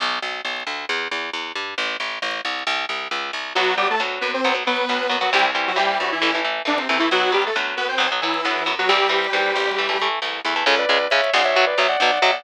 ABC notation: X:1
M:4/4
L:1/16
Q:1/4=135
K:Bphr
V:1 name="Lead 2 (sawtooth)"
z16 | z16 | [F,F]2 [G,G] [A,A] z2 [B,B] [Cc]2 z [B,B]5 [F,F] | [G,G] z2 [F,F] [G,G]2 [F,F] [E,E]3 z2 [D,D] [C,C] [C,C] [E,E] |
[F,F]2 [G,G] [A,A] z2 [B,B] [Cc]2 z [E,E]5 [F,F] | [G,G]12 z4 | [K:C#phr] z16 |]
V:2 name="Distortion Guitar"
z16 | z16 | z16 | z16 |
z16 | z16 | [K:C#phr] [Ac] [Bd]3 [ce]2 [df] [ce]2 [Bd] [ce] [df] [df]2 [ce] [df] |]
V:3 name="Overdriven Guitar"
z16 | z16 | [F,B,]2 [F,B,]2 [F,B,]4 [F,B,] [F,B,] [F,B,]2 [F,B,]2 [F,B,] [F,B,] | [E,G,C]2 [E,G,C]2 [E,G,C]4 [E,A,] [E,A,] [E,A,]2 [E,A,]2 [E,A,] [E,A,] |
[F,B,]2 [F,B,]2 [F,B,]4 [F,B,] [F,B,] [F,B,]2 [F,B,]2 [F,B,] [F,B,] | [E,G,C]2 [E,G,C]2 [E,G,C]4 [E,A,] [E,A,] [E,A,]2 [E,A,]2 [E,A,] [E,A,] | [K:C#phr] [C,G,]2 [C,G,]2 [C,G,]2 [C,G,]2 [B,,F,]2 [B,,F,]2 [B,,F,]2 [B,,F,]2 |]
V:4 name="Electric Bass (finger)" clef=bass
B,,,2 B,,,2 B,,,2 D,,2 E,,2 E,,2 E,,2 G,,2 | A,,,2 A,,,2 A,,,2 C,,2 C,,2 C,,2 ^C,,2 =C,,2 | B,,,4 D,,2 F,,2 B,,,4 D,,2 F,,2 | C,,4 ^D,,2 G,,2 A,,,4 C,,2 E,,2 |
B,,,4 D,,2 F,,2 B,,,4 D,,2 F,,2 | C,,4 ^D,,2 A,,,6 C,,2 E,,2 | [K:C#phr] C,,2 C,,2 C,,2 B,,,4 B,,,2 B,,,2 B,,,2 |]